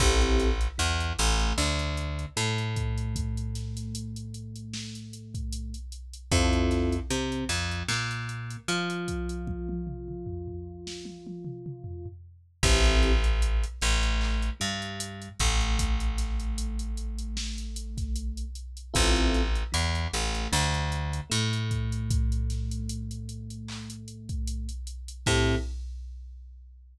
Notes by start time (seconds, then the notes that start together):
0.00 A1 C4 E4 G4 A4, kick, crash
0.21 closed hi-hat
0.40 snare, closed hi-hat
0.61 closed hi-hat
0.78 E2 E3, closed hi-hat
1.00 closed hi-hat
1.19 A1 A3, closed hi-hat
1.40 closed hi-hat
1.57 D2 D3, clap
1.79 closed hi-hat
1.97 closed hi-hat
2.19 closed hi-hat
2.37 A2 A3, closed hi-hat
2.58 closed hi-hat
2.76 kick, closed hi-hat
2.98 closed hi-hat
3.16 kick, closed hi-hat
3.37 closed hi-hat
3.55 snare, closed hi-hat
3.77 snare, closed hi-hat
3.95 closed hi-hat
4.16 closed hi-hat
4.34 closed hi-hat
4.56 closed hi-hat
4.74 snare
4.95 closed hi-hat
5.13 closed hi-hat
5.34 kick, closed hi-hat
5.52 closed hi-hat
5.74 closed hi-hat
5.92 closed hi-hat
6.13 closed hi-hat
6.32 F2 C4 E4 F4 A4, kick, closed hi-hat
6.53 closed hi-hat
6.71 snare, closed hi-hat
6.92 closed hi-hat
7.10 C3 C4, closed hi-hat
7.32 closed hi-hat
7.49 F2 F3, closed hi-hat
7.71 closed hi-hat
7.88 A#2 A#3, snare
8.11 closed hi-hat
8.29 closed hi-hat
8.50 closed hi-hat
8.68 F3 F4, closed hi-hat
8.90 closed hi-hat
9.08 kick, closed hi-hat
9.29 closed hi-hat
9.47 kick, high tom
9.69 high tom
9.87 mid tom
10.08 mid tom
10.26 floor tom
10.48 floor tom
10.87 snare
11.05 high tom
11.27 high tom
11.45 mid tom
11.66 mid tom
11.84 floor tom
12.06 floor tom
12.63 A1 C4 E4 G4 A4, kick, crash
12.85 closed hi-hat
13.03 snare, closed hi-hat
13.24 closed hi-hat
13.42 closed hi-hat
13.63 closed hi-hat
13.81 A1 A3, closed hi-hat
14.03 closed hi-hat
14.21 clap
14.42 closed hi-hat
14.60 G2 G3, closed hi-hat
14.82 closed hi-hat
15.00 closed hi-hat
15.22 closed hi-hat
15.39 A1 A3, kick, closed hi-hat
15.61 closed hi-hat
15.79 kick, closed hi-hat
16.00 closed hi-hat
16.18 snare, closed hi-hat
16.40 closed hi-hat
16.58 closed hi-hat
16.79 closed hi-hat
16.97 closed hi-hat
17.18 closed hi-hat
17.37 snare
17.58 closed hi-hat
17.76 closed hi-hat
17.98 kick, snare, closed hi-hat
18.16 closed hi-hat
18.37 closed hi-hat
18.55 closed hi-hat
18.77 closed hi-hat
18.94 A1 C4 E4 F4 A4, kick, closed hi-hat
19.16 closed hi-hat
19.34 snare, closed hi-hat
19.55 closed hi-hat
19.72 E2 E3, closed hi-hat
19.95 closed hi-hat
20.13 A1 A3, closed hi-hat
20.35 closed hi-hat
20.52 D2 D3, snare
20.74 closed hi-hat
20.92 closed hi-hat
21.13 closed hi-hat
21.30 A2 A3, closed hi-hat
21.53 closed hi-hat
21.71 kick, closed hi-hat
21.92 closed hi-hat
22.11 kick, closed hi-hat
22.32 closed hi-hat
22.50 snare, closed hi-hat
22.71 closed hi-hat
22.89 closed hi-hat
23.11 closed hi-hat
23.29 closed hi-hat
23.50 closed hi-hat
23.68 clap
23.90 closed hi-hat
24.08 closed hi-hat
24.29 kick, closed hi-hat
24.47 closed hi-hat
24.69 closed hi-hat
24.87 closed hi-hat
25.08 closed hi-hat
25.26 A2 C4 E4 G4 A4, kick, crash